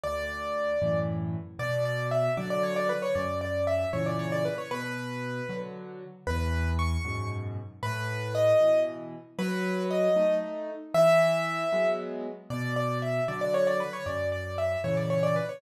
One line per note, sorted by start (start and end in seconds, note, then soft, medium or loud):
0.03 0.74 D2 medium
0.03 0.98 D5 loud
0.82 1.36 F#2 medium
0.82 1.36 A2 medium
0.82 1.36 E3 medium
1.59 2.29 B2 loud
1.59 1.84 D5 loud
1.85 2.07 D5 loud
2.11 2.33 E5 medium
2.37 2.92 D3 medium
2.37 2.92 F#3 medium
2.37 2.50 D5 medium
2.50 2.63 D5 loud
2.63 2.76 C#5 loud
2.76 2.89 D5 loud
2.89 3.02 B4 loud
3.02 3.15 C#5 loud
3.15 3.85 F#2 medium
3.15 3.39 D5 medium
3.41 3.66 D5 medium
3.67 3.90 E5 medium
3.93 4.48 A#2 medium
3.93 4.48 C#3 medium
3.93 4.48 E3 medium
3.93 4.05 C#5 medium
4.06 4.18 D5 medium
4.19 4.31 C#5 loud
4.32 4.44 D5 loud
4.45 4.57 B4 loud
4.58 4.70 C#5 medium
4.71 5.41 B2 medium
4.71 5.56 B4 loud
5.49 6.04 D3 medium
5.49 6.04 F#3 medium
6.27 6.97 E2 loud
6.27 6.69 B4 loud
6.79 7.29 C#6 loud
7.05 7.59 F#2 medium
7.05 7.59 G#2 medium
7.05 7.59 B2 medium
7.83 8.53 A2 loud
7.83 8.33 B4 loud
8.35 8.80 D#5 loud
8.60 9.15 B2 medium
8.60 9.15 E3 medium
9.39 10.09 F#3 loud
9.39 9.83 B4 loud
9.90 10.35 D#5 loud
10.16 10.71 A3 medium
10.16 10.71 D#4 medium
10.94 11.64 E3 loud
10.94 11.89 E5 loud
11.73 12.27 F#3 medium
11.73 12.27 G#3 medium
11.73 12.27 B3 medium
12.50 13.20 B2 loud
12.50 12.74 D5 loud
12.76 12.98 D5 loud
13.02 13.24 E5 medium
13.28 13.83 D3 medium
13.28 13.83 F#3 medium
13.28 13.40 D5 medium
13.41 13.53 D5 loud
13.54 13.66 C#5 loud
13.67 13.79 D5 loud
13.80 13.92 B4 loud
13.93 14.05 C#5 loud
14.06 14.76 F#2 medium
14.06 14.30 D5 medium
14.32 14.56 D5 medium
14.58 14.81 E5 medium
14.84 15.39 A#2 medium
14.84 15.39 C#3 medium
14.84 15.39 E3 medium
14.84 14.96 C#5 medium
14.97 15.09 D5 medium
15.10 15.22 C#5 medium
15.23 15.35 D5 loud
15.36 15.48 B4 medium
15.49 15.61 C#5 medium